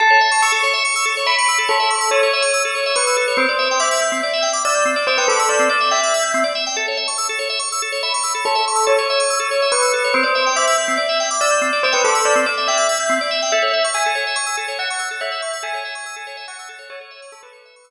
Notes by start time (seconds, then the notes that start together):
0.00 A4 A5
0.10 C#5
0.21 E5
0.31 C#6
0.42 C#6 E6
0.52 A4
0.63 C#5
0.73 E5
0.85 C#6
0.96 E6
1.05 A4
1.17 C#5
1.26 E5 B5
1.38 C#6
1.48 E6
1.58 A4
1.68 A4 C#5
1.80 E5
1.90 C#6
2.01 E6
2.11 A4 C#5
2.23 C#5
2.33 E5
2.42 C#6
2.54 E6
2.65 A4
2.75 C#5
2.86 E5
2.96 B4 C#6
3.07 E6
3.17 A4
3.28 C#5
3.37 C4 C5
3.49 D5
3.59 E5
3.71 G5
3.80 E5 D6
3.91 E6
4.01 G6
4.12 C4
4.23 D5
4.33 E5
4.42 G5
4.53 D6
4.65 D5 E6
4.75 G6
4.85 C4
4.96 D5
5.07 C5 E5
5.18 B4 G5
5.28 A4 D6
5.39 E6
5.49 D5 G6
5.59 C4
5.69 D5
5.81 E5
5.91 E5 G5
6.03 D6
6.14 E6
6.23 G6
6.34 C4
6.44 D5
6.55 E5
6.67 G5
6.76 A4 A5
6.88 C#5
6.97 E5
7.08 C#6
7.18 C#6 E6
7.29 A4
7.39 C#5
7.50 E5
7.59 C#6
7.72 E6
7.82 A4
7.92 C#5
8.03 E5 B5
8.14 C#6
8.23 E6
8.35 A4
8.45 A4 C#5
8.55 E5
8.68 C#6
8.76 E6
8.87 A4 C#5
8.99 C#5
9.10 E5
9.20 C#6
9.30 E6
9.40 A4
9.51 C#5
9.62 E5
9.72 B4 C#6
9.82 E6
9.93 A4
10.04 C#5
10.14 C4 C5
10.23 D5
10.35 E5
10.46 G5
10.56 E5 D6
10.67 E6
10.78 G6
10.88 C4
10.97 D5
11.09 E5
11.20 G5
11.31 D6
11.41 D5 E6
11.50 G6
11.62 C4
11.73 D5
11.83 C5 E5
11.93 B4 G5
12.04 A4 D6
12.15 E6
12.25 D5 G6
12.35 C4
12.46 D5
12.58 E5
12.68 E5 G5
12.78 D6
12.89 E6
13.00 G6
13.09 C4
13.21 D5
13.31 E5
13.42 G5
13.52 A4 E5
13.62 C#5
13.73 E5
13.84 C#6
13.94 G#5 E6
14.06 A4
14.15 C#5
14.27 E5
14.36 C#6
14.46 E6
14.57 A4
14.68 C#5
14.79 E5 F#5
14.90 C#6
14.99 E6
15.11 A4
15.21 C#5 E5
15.32 E5
15.42 C#6
15.53 E6
15.63 A4 G#5
15.74 C#5
15.85 E5
15.95 C#6
16.06 E6
16.16 A4
16.27 C#5
16.37 E5
16.48 F#5 C#6
16.59 E6
16.69 A4
16.79 C#5
16.90 A4 C#5
17.01 C#5
17.11 E5
17.22 C#6
17.32 A4 E6
17.43 A4 B4
17.53 C#5
17.65 E5
17.76 C#6
17.84 E6